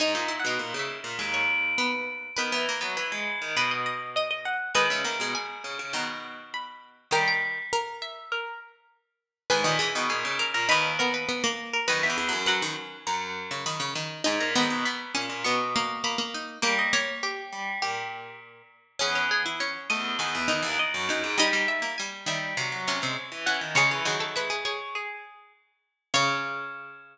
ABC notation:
X:1
M:4/4
L:1/16
Q:1/4=101
K:G#m
V:1 name="Pizzicato Strings"
(3g4 f4 e4 z c3 B4 | B2 z2 B4 B d d2 d d f2 | d e3 g4 a z3 b4 | =g g z4 e2 A2 z6 |
G4 G3 A B2 A B z3 A | d e3 f4 a z3 b4 | g a3 b4 c' z3 b4 | =g d c2 =G4 G4 z4 |
[K:C#m] G2 G z c2 d2 g4 d4 | d2 e2 g z e2 z6 f z | c z3 e2 c2 G4 z4 | c16 |]
V:2 name="Pizzicato Strings"
D12 B,4 | B12 d4 | B16 | A4 A6 z6 |
B2 G4 A2 D2 B,2 B, A,3 | B4 B8 z4 | D2 B,4 C2 B,2 A,2 A, A,3 | A,2 A,8 z6 |
[K:C#m] C6 z4 D4 D2 | D6 z4 C4 C2 | G2 G A B G G6 z4 | c16 |]
V:3 name="Pizzicato Strings"
D D E D5 G,6 z2 | B, B, A, B,5 F6 z2 | G, G, A, G,5 D,6 z2 | D,4 z12 |
D, D, E, D,5 D,6 z2 | (3D,2 E,2 F,2 F, D, z5 C, D, C, D,2 | z2 D,2 B,2 z2 B,4 z2 D2 | A,4 z12 |
[K:C#m] C C z E C2 A,2 D,2 D, E, z4 | =G, G, z ^A, G,2 D,2 ^B,,2 B,, B,, z4 | C,2 D,6 z8 | C,16 |]
V:4 name="Pizzicato Strings" clef=bass
G,, A,,2 B,, A,, C,2 A,, D,,8 | D, E,2 F, E, G,2 D, B,,8 | D, C, D, B,, z2 C, C, B,,8 | =G,10 z6 |
G,, A,,2 B,, A,, C,2 A,, D,,8 | F,, E,, E,, F,,5 F,,8 | G,, A,, G,, B,, z2 A,, A,, B,,8 | =G,6 G,2 A,,6 z2 |
[K:C#m] E,,6 E,,2 E,, E,,2 D,, z F,, F,, G,, | =G,6 G,2 F, F,2 ^G, z E, E, D, | G, E, F,2 G,6 z6 | C,16 |]